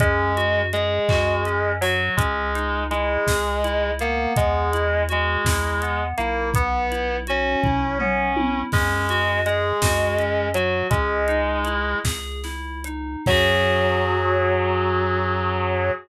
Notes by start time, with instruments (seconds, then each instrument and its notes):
0.00 synth bass 1 F#2, distortion guitar G#3, electric piano 2 C#4, kick, closed hi-hat
0.36 electric piano 2 F#4, closed hi-hat
0.73 distortion guitar G#3, electric piano 2 G#4, closed hi-hat
1.09 synth bass 1 F#2, electric piano 2 F#4, kick, clap
1.45 electric piano 2 C#4, closed hi-hat
1.81 distortion guitar F#3, electric piano 2 F#4, open hi-hat
2.16 synth bass 1 C#2, distortion guitar G#3, electric piano 2 C#4, kick, closed hi-hat
2.54 electric piano 2 D#4, closed hi-hat
2.90 distortion guitar G#3, electric piano 2 E4, closed hi-hat
3.27 synth bass 1 C#2, electric piano 2 G#4, kick, snare
3.64 electric piano 2 E4, closed hi-hat
3.99 distortion guitar A#3, electric piano 2 B3, closed hi-hat
4.36 synth bass 1 E2, distortion guitar G#3, kick, closed hi-hat
4.73 electric piano 2 E4, closed hi-hat
5.09 distortion guitar G#3, electric piano 2 F#4, closed hi-hat
5.45 synth bass 1 E2, electric piano 2 E4, kick, snare
5.82 electric piano 2 B3, closed hi-hat
6.17 synth bass 1 B1, distortion guitar A#3, electric piano 2 E4, closed hi-hat
6.54 electric piano 2 B3, distortion guitar B3, kick, closed hi-hat
6.91 electric piano 2 E4, closed hi-hat
7.27 distortion guitar C#4, electric piano 2 F#4, closed hi-hat
7.63 synth bass 1 B1, electric piano 2 E4, kick, floor tom
7.98 electric piano 2 B3, distortion guitar C#4, mid tom
8.36 electric piano 2 E4, high tom
8.72 synth bass 1 F#2, distortion guitar G#3, electric piano 2 C#4, kick, crash
9.09 electric piano 2 F#4, closed hi-hat
9.45 distortion guitar G#3, electric piano 2 G#4, closed hi-hat
9.82 synth bass 1 F#2, electric piano 2 F#4, kick, snare
10.18 electric piano 2 C#4, closed hi-hat
10.54 distortion guitar F#3, electric piano 2 F#4, closed hi-hat
10.90 synth bass 1 C#2, distortion guitar G#3, electric piano 2 C#4, kick, closed hi-hat
11.28 electric piano 2 D#4, closed hi-hat
11.65 electric piano 2 E4, closed hi-hat
12.04 synth bass 1 C#2, electric piano 2 G#4, kick, snare
12.43 electric piano 2 E4, snare
12.84 electric piano 2 D#4, closed hi-hat
13.26 synth bass 1 F#2, distortion guitar F#3, electric piano 2 C#4 F#4 G#4, kick, crash